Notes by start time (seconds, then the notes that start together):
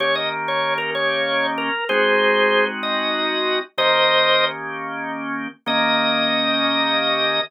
0.00 D#3 A#3 C#4 G4 C#5
0.15 D#5
0.48 C#5
0.78 A#4
0.95 C#5
1.58 A#4
1.89 G#3 C4 D#4 F#4 G#4 C5
2.83 D#5
3.78 D#3 A#3 C#4 G4 C5 D#5
5.66 D#3 A#3 C#4 G4 D#5